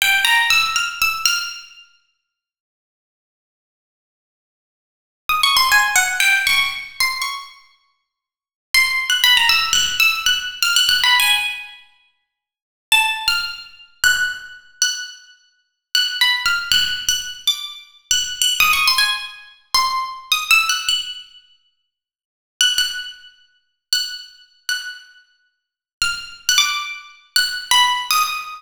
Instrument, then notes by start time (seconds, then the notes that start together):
pizzicato strings
0.02 G5
0.25 A#5
0.50 E6
0.76 F6
1.02 E6
1.25 F6
5.29 D#6
5.43 C#6
5.57 C6
5.72 G#5
5.96 F#5
6.20 G5
6.47 C#6
7.00 C6
7.22 C#6
8.74 C6
9.10 F#6
9.24 B5
9.37 A#5
9.49 E6
9.73 F#6
10.00 E6
10.26 F#6
10.63 F6
10.76 F#6
10.89 F#6
11.04 B5
11.20 G#5
12.92 A5
13.28 F6
14.04 F#6
14.82 F#6
15.95 F#6
16.21 B5
16.46 F6
16.72 F#6
17.09 F#6
17.47 D6
18.11 F#6
18.42 F#6
18.60 D#6
18.73 C#6
18.88 C6
18.98 G#5
19.74 C6
20.32 D#6
20.51 E6
20.69 F#6
20.89 F#6
22.61 F#6
22.78 F#6
23.93 F#6
24.69 F#6
26.02 F6
26.49 F#6
26.58 D6
27.36 F#6
27.71 B5
28.11 D#6